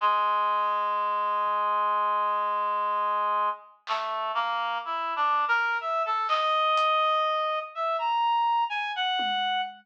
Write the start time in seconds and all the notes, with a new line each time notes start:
0.01 G#3
1.45 floor tom
3.87 A3, clap
4.34 A#3
4.85 E4
5.16 D4
5.32 floor tom
5.48 A#4
5.80 E5
6.05 A4
6.28 D#5, clap
6.77 closed hi-hat
7.75 E5
7.98 A#5
8.70 G#5
8.96 F#5
9.19 high tom